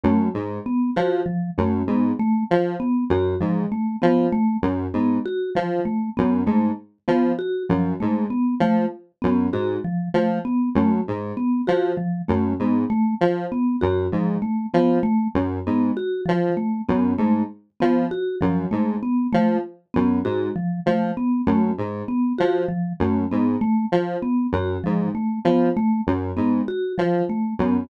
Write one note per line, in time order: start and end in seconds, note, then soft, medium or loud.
0.03 0.28 F#2 medium
0.03 0.29 A3 medium
0.34 0.58 G#2 medium
0.66 0.90 B3 medium
0.96 1.21 F3 medium
0.96 1.21 F#4 medium
1.26 1.50 F3 medium
1.58 1.82 F#2 medium
1.58 1.83 A3 medium
1.87 2.11 G#2 medium
1.87 2.13 B3 medium
2.19 2.44 A3 medium
2.51 2.75 F3 medium
2.80 3.04 B3 medium
3.10 3.34 F#2 medium
3.10 3.35 F#4 medium
3.40 3.65 G#2 medium
3.40 3.65 F3 medium
3.72 3.96 A3 medium
4.02 4.27 F3 medium
4.02 4.26 B3 medium
4.32 4.57 A3 medium
4.62 4.87 F#2 medium
4.93 5.18 G#2 medium
4.93 5.19 B3 medium
5.26 5.50 F#4 medium
5.55 5.80 F3 medium
5.85 6.10 A3 medium
6.17 6.42 F#2 medium
6.17 6.42 B3 medium
6.46 6.71 G#2 medium
6.46 6.72 A3 medium
7.08 7.32 F3 medium
7.08 7.32 B3 medium
7.39 7.63 F#4 medium
7.69 7.94 F#2 medium
7.69 7.94 F3 medium
8.00 8.26 G#2 medium
8.00 8.25 A3 medium
8.30 8.55 B3 medium
8.60 8.84 F3 medium
8.60 8.86 A3 medium
9.22 9.48 F#2 medium
9.22 9.46 B3 medium
9.52 9.77 G#2 medium
9.52 9.78 F#4 medium
9.84 10.09 F3 medium
10.14 10.38 F3 medium
10.14 10.39 A3 medium
10.45 10.69 B3 medium
10.75 10.99 F#2 medium
10.75 11.01 A3 medium
11.08 11.32 G#2 medium
11.37 11.61 B3 medium
11.67 11.92 F3 medium
11.67 11.92 F#4 medium
11.97 12.22 F3 medium
12.28 12.53 F#2 medium
12.28 12.53 A3 medium
12.59 12.84 G#2 medium
12.59 12.85 B3 medium
12.90 13.14 A3 medium
13.21 13.45 F3 medium
13.52 13.76 B3 medium
13.81 14.07 F#2 medium
13.81 14.06 F#4 medium
14.12 14.36 G#2 medium
14.12 14.37 F3 medium
14.42 14.66 A3 medium
14.74 14.98 F3 medium
14.74 14.98 B3 medium
15.03 15.28 A3 medium
15.34 15.59 F#2 medium
15.66 15.91 G#2 medium
15.66 15.91 B3 medium
15.97 16.21 F#4 medium
16.26 16.50 F3 medium
16.26 16.53 F3 medium
16.57 16.82 A3 medium
16.89 17.13 F#2 medium
16.89 17.13 B3 medium
17.18 17.42 G#2 medium
17.18 17.43 A3 medium
17.80 18.06 F3 medium
17.80 18.05 B3 medium
18.11 18.36 F#4 medium
18.41 18.66 F#2 medium
18.41 18.65 F3 medium
18.71 18.96 G#2 medium
18.71 18.96 A3 medium
19.03 19.27 B3 medium
19.33 19.58 F3 medium
19.33 19.57 A3 medium
19.94 20.20 F#2 medium
19.94 20.18 B3 medium
20.24 20.49 G#2 medium
20.24 20.49 F#4 medium
20.56 20.80 F3 medium
20.86 21.11 F3 medium
20.86 21.12 A3 medium
21.17 21.42 B3 medium
21.47 21.71 F#2 medium
21.47 21.72 A3 medium
21.78 22.02 G#2 medium
22.08 22.33 B3 medium
22.38 22.64 F3 medium
22.38 22.63 F#4 medium
22.68 22.93 F3 medium
23.00 23.24 F#2 medium
23.00 23.26 A3 medium
23.31 23.56 G#2 medium
23.31 23.56 B3 medium
23.61 23.86 A3 medium
23.92 24.16 F3 medium
24.22 24.47 B3 medium
24.52 24.77 F#2 medium
24.52 24.79 F#4 medium
24.84 25.10 G#2 medium
24.84 25.08 F3 medium
25.15 25.39 A3 medium
25.45 25.69 F3 medium
25.45 25.69 B3 medium
25.77 26.01 A3 medium
26.07 26.31 F#2 medium
26.37 26.61 G#2 medium
26.37 26.61 B3 medium
26.68 26.93 F#4 medium
26.98 27.22 F3 medium
26.98 27.23 F3 medium
27.29 27.54 A3 medium
27.59 27.83 F#2 medium
27.59 27.84 B3 medium